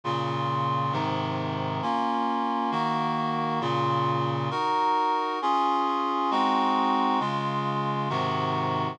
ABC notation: X:1
M:6/8
L:1/8
Q:3/8=134
K:Bbm
V:1 name="Clarinet"
[B,,D,F]6 | [A,,C,E,]6 | [B,DF]6 | [E,B,G]6 |
[B,,D,F]6 | [EGB]6 | [K:Db] [DFA]6 | [A,CEG]6 |
[D,A,F]6 | [A,,C,E,G]6 |]